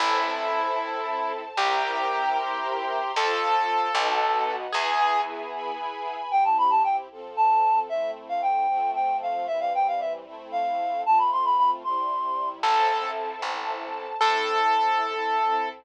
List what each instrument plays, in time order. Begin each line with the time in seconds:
0.00 electric bass (finger) A1, string ensemble 1 C4 E4 A4 C5 E5 A5, acoustic grand piano E4
0.79 string ensemble 1 A4 C5 A5
1.57 electric bass (finger) C2, string ensemble 1 C4 E4 G4 A#4 C5 E5 G5 A#5, acoustic grand piano G4
2.37 string ensemble 1 C5 E5 A#5 C6
3.15 electric bass (finger) F2, string ensemble 1 C4 F4 A4 C5 F5 A5, acoustic grand piano A4
3.94 electric bass (finger) B1, string ensemble 1 B3 D#4 F#4 B4 D#5 F#5
4.72 electric bass (finger) E2, string ensemble 1 B3 E4 G#4 B4 E5 G#5, acoustic grand piano G#4
5.54 string ensemble 1 B4 G#5 B5
6.30 string ensemble 1 C4 E4 G4, clarinet G5
6.45 clarinet A5
6.58 clarinet B5
6.70 clarinet A5
6.84 clarinet G5
7.11 string ensemble 1 F3 C4 A4
7.37 clarinet A5
7.89 string ensemble 1 A3 C4 E4, clarinet E5
8.29 clarinet F5
8.42 clarinet G5
8.69 string ensemble 1 F3 A3 C4
8.95 clarinet G5
9.22 clarinet F5
9.47 string ensemble 1 E3 G3 C4, clarinet E5
9.60 clarinet F5
9.75 clarinet G5
9.88 clarinet F5
10.00 clarinet E5
10.26 string ensemble 1 A3 C4 E4
10.52 clarinet F5
11.05 string ensemble 1 A3 C4 F4, clarinet A5
11.18 clarinet B5
11.32 clarinet C6
11.45 clarinet B5
11.58 clarinet B5
11.84 string ensemble 1 C3 G3 E4, clarinet C6
12.63 electric bass (finger) A1, string ensemble 1 C4 E4 A4 C5 E5 A5, acoustic grand piano A4
13.42 electric bass (finger) A1, string ensemble 1 A4 C5 A5
14.21 electric bass (finger) A2, string ensemble 1 C4 E4 A4, acoustic grand piano A4